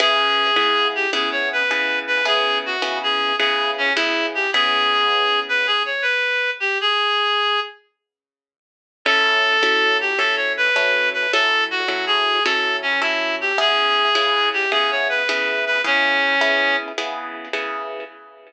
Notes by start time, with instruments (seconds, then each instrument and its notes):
0.00 acoustic guitar (steel) C#3 B3 E4 G#4, clarinet G#4
0.56 acoustic guitar (steel) C#3 B3 E4 G#4
0.95 clarinet G4
1.13 acoustic guitar (steel) C#3 B3 E4 G#4, clarinet G#4
1.32 clarinet C#5
1.53 clarinet B4
1.71 acoustic guitar (steel) C#3 B3 E4 G#4
2.07 clarinet B4
2.25 acoustic guitar (steel) C#3 B3 E4 G#4, clarinet G#4
2.66 clarinet F#4
2.82 acoustic guitar (steel) C#3 B3 E4 G#4
3.03 clarinet G#4
3.39 acoustic guitar (steel) C#3 B3 E4 G#4, clarinet G#4
3.78 clarinet C#4
3.96 acoustic guitar (steel) C#3 B3 E4 G#4, clarinet E4
4.35 clarinet G4
4.53 acoustic guitar (steel) C#3 B3 E4 G#4, clarinet G#4
5.49 clarinet B4
5.67 clarinet G#4
5.85 clarinet C#5
6.02 clarinet B4
6.60 clarinet G4
6.81 clarinet G#4
9.05 acoustic guitar (steel) F#3 C#4 E4 A4, clarinet A4
9.63 acoustic guitar (steel) F#3 C#4 E4 A4
10.01 clarinet G4
10.18 acoustic guitar (steel) F#3 C#4 E4 A4, clarinet A4
10.36 clarinet C#5
10.57 clarinet B4
10.76 acoustic guitar (steel) F#3 C#4 E4 A4
11.13 clarinet B4
11.32 acoustic guitar (steel) F#3 C#4 E4 A4, clarinet A4
11.71 clarinet F#4
11.88 acoustic guitar (steel) F#3 C#4 E4 A4
12.07 clarinet G#4
12.44 acoustic guitar (steel) F#3 C#4 E4 A4, clarinet A4
12.82 clarinet C#4
13.01 acoustic guitar (steel) F#3 C#4 E4 A4, clarinet E4
13.41 clarinet G4
13.58 acoustic guitar (steel) C#3 B3 E4 G#4, clarinet G#4
14.15 acoustic guitar (steel) C#3 B3 E4 G#4
14.53 clarinet G4
14.72 acoustic guitar (steel) C#3 B3 E4 G#4, clarinet G#4
14.91 clarinet C#5
15.09 clarinet B4
15.29 acoustic guitar (steel) C#3 B3 E4 G#4
15.66 clarinet B4
15.84 acoustic guitar (steel) C#3 B3 E4 G#4, clarinet C#4
16.41 acoustic guitar (steel) C#3 B3 E4 G#4
16.98 acoustic guitar (steel) C#3 B3 E4 G#4
17.53 acoustic guitar (steel) C#3 B3 E4 G#4